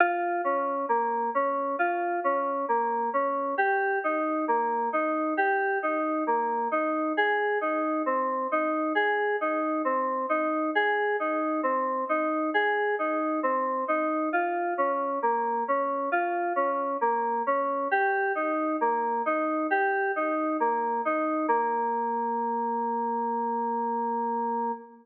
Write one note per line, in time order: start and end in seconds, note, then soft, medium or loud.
0.00 0.41 F4 medium
0.44 0.86 C#4 medium
0.89 1.30 A#3 medium
1.35 1.76 C#4 medium
1.79 2.20 F4 medium
2.24 2.65 C#4 medium
2.68 3.10 A#3 medium
3.13 3.55 C#4 medium
3.58 3.99 G4 medium
4.04 4.45 D#4 medium
4.48 4.89 A#3 medium
4.93 5.34 D#4 medium
5.37 5.78 G4 medium
5.83 6.24 D#4 medium
6.27 6.68 A#3 medium
6.71 7.13 D#4 medium
7.17 7.58 G#4 medium
7.61 8.02 D#4 medium
8.06 8.47 C4 medium
8.52 8.93 D#4 medium
8.95 9.36 G#4 medium
9.41 9.82 D#4 medium
9.85 10.26 C4 medium
10.29 10.71 D#4 medium
10.75 11.16 G#4 medium
11.20 11.61 D#4 medium
11.63 12.04 C4 medium
12.09 12.50 D#4 medium
12.54 12.95 G#4 medium
12.99 13.40 D#4 medium
13.43 13.84 C4 medium
13.88 14.29 D#4 medium
14.33 14.74 F4 medium
14.78 15.19 C#4 medium
15.22 15.64 A#3 medium
15.68 16.09 C#4 medium
16.12 16.53 F4 medium
16.56 16.97 C#4 medium
17.01 17.42 A#3 medium
17.47 17.88 C#4 medium
17.91 18.32 G4 medium
18.35 18.76 D#4 medium
18.81 19.22 A#3 medium
19.26 19.67 D#4 medium
19.71 20.12 G4 medium
20.16 20.57 D#4 medium
20.60 21.01 A#3 medium
21.05 21.46 D#4 medium
21.48 24.72 A#3 loud